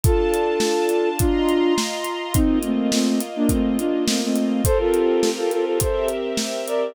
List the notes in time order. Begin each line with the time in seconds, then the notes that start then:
0.03 D4 F4 A4 A5, kick, closed hi-hat
0.34 closed hi-hat
0.60 snare
0.89 closed hi-hat
1.19 D4 F4 D#5 A#5 C6, kick, closed hi-hat
1.49 closed hi-hat
1.78 snare
2.04 closed hi-hat
2.34 A#3 C4 D#4 F4 D#5, kick, closed hi-hat
2.63 A3 C4, closed hi-hat
2.91 A3 C4, snare
3.21 closed hi-hat
3.36 A#3 D4
3.49 A3 C4, kick, closed hi-hat
3.78 D4 F4, closed hi-hat
4.07 A3 C4, snare
4.23 A3 C4
4.36 closed hi-hat
4.64 C4 F4 G4 A4 A#4 C5, kick, closed hi-hat
4.79 F4 A4
4.94 closed hi-hat
5.23 snare
5.37 F4 A4
5.51 F4 A4, closed hi-hat
5.65 F4 A4
5.80 C4 G4 A4 A#4 C5 E5, kick, closed hi-hat
6.08 closed hi-hat
6.37 snare
6.67 A#4 D5, closed hi-hat